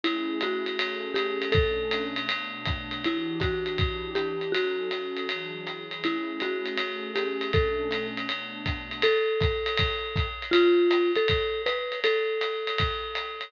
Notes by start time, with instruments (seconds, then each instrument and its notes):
0.04 pad 2 (warm) A3 C#4 E4 G#4, marimba E4, ride
0.41 marimba F#4, hi-hat pedal, ride
0.66 ride
0.78 pad 2 (warm) A3 C#4 G#4 A4, ride
1.14 marimba G4, hi-hat pedal, ride
1.42 ride
1.52 pad 2 (warm) B2 A3 C#4 D4, marimba A4, kick, ride
1.91 hi-hat pedal, ride
2.16 ride
2.29 pad 2 (warm) B2 A3 B3 D4, ride
2.65 kick, hi-hat pedal, ride
2.91 ride
3.04 pad 2 (warm) E3 D4 F#4 G4, marimba E4, ride
3.40 marimba F#4, kick, hi-hat pedal, ride
3.66 ride
3.78 pad 2 (warm) E3 D4 E4 G4, kick, ride
4.15 marimba G4, hi-hat pedal, ride
4.41 ride
4.52 pad 2 (warm) F#3 C#4 D#4 A4, marimba F#4, ride
4.91 pad 2 (warm) F#3 C#4 F#4 A4, hi-hat pedal, ride
5.17 ride
5.29 pad 2 (warm) E3 F#3 D4 G#4, ride
5.67 pad 2 (warm) E3 F#3 E4 G#4, hi-hat pedal, ride
5.91 ride
6.03 pad 2 (warm) A3 C#4 E4 G#4, marimba E4, ride
6.40 marimba F#4, hi-hat pedal, ride
6.66 ride
6.78 pad 2 (warm) A3 C#4 G#4 A4, ride
7.15 marimba G4, hi-hat pedal, ride
7.41 ride
7.53 pad 2 (warm) B2 A3 C#4 D4, marimba A4, kick, ride
7.91 hi-hat pedal, ride
8.17 ride
8.28 pad 2 (warm) B2 A3 B3 D4, ride
8.66 kick, hi-hat pedal, ride
8.91 ride
9.02 marimba A4, ride
9.40 kick, hi-hat pedal, ride
9.66 ride
9.77 kick, ride
10.16 kick, hi-hat pedal, ride
10.42 ride
10.51 marimba F4, ride
10.91 hi-hat pedal, ride
11.15 marimba A4, ride
11.28 kick, ride
11.66 marimba B4, hi-hat pedal, ride
11.92 ride
12.04 marimba A4, ride
12.41 hi-hat pedal, ride
12.67 ride
12.78 kick, ride
13.15 hi-hat pedal, ride
13.41 ride